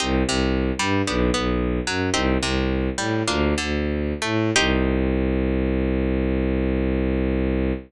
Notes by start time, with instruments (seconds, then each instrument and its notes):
0.00 violin C2, acoustic guitar (steel) C4 D#4 G4
0.26 violin C2, acoustic guitar (steel) C3
0.79 violin G2, acoustic guitar (steel) G3
1.07 violin B1, acoustic guitar (steel) B3 D4 G4
1.34 violin B1, acoustic guitar (steel) B3
1.87 violin F#2, acoustic guitar (steel) F#3
2.14 violin C2, acoustic guitar (steel) C4 D#4 G4
2.41 violin C2, acoustic guitar (steel) C3
2.98 violin A2, acoustic guitar (steel) G3
3.27 violin D2, acoustic guitar (steel) A#3 D4 F4
3.58 violin D2, acoustic guitar (steel) D3
4.22 violin A2, acoustic guitar (steel) A3
4.56 violin C2, acoustic guitar (steel) C4 D#4 G4